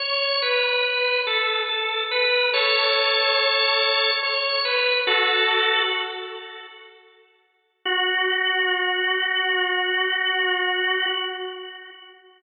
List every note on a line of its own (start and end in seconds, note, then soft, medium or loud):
0.00 0.36 C#5 medium
0.42 1.21 B4 medium
1.27 1.62 A4 medium
1.69 2.04 A4 medium
2.11 2.50 B4 medium
2.54 4.11 A4 medium
2.54 4.11 C#5 medium
4.23 4.60 C#5 medium
4.65 5.01 B4 medium
5.07 5.82 F#4 medium
5.07 5.82 A4 medium
7.85 11.06 F#4 loud